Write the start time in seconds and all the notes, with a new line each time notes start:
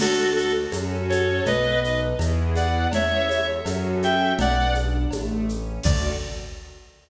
0.00 D2 D4 F#4 A4, crash, cowbell, low conga, shaker
0.35 F#4 A4, shaker
0.72 F#2 C#4 F#4 A4, cowbell, high conga, shaker
1.09 A4 C#5, high conga, shaker
1.45 B1 B3 B4 D#5, cowbell, low conga, shaker
1.83 D#4 B4 D#5, shaker
2.19 E2 B3 E4 G#4, cowbell, high conga, shaker
2.55 D5 F#5, high conga, shaker
2.92 E2 C#4 C#5 E5, cowbell, low conga, shaker
3.29 A4 C#5 E5, high conga, shaker
3.65 F#2 C#4 F#4 A4, cowbell, high conga, shaker
4.02 E5 G5, high conga, shaker
4.39 B1 B3 D5 F#5, cowbell, low conga, shaker
4.75 D4, high conga, shaker
5.11 A1 A3, cowbell, high conga, shaker
5.49 C#4, shaker
5.83 D2 D4 F#4 A4 D5, kick, crash